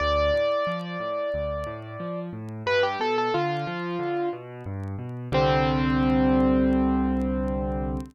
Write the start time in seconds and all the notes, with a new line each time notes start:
0.00 D2 D5
0.34 A2
0.67 F3
1.00 A2
1.34 D2
1.67 A2
2.00 F3
2.33 A2
2.66 G2 B4
2.83 G4
3.00 B2 A4
3.18 A4
3.34 D3 F4
3.67 F3
3.99 D3
4.33 B2
4.66 G2
4.98 B2
5.32 C2 D3 G3 C4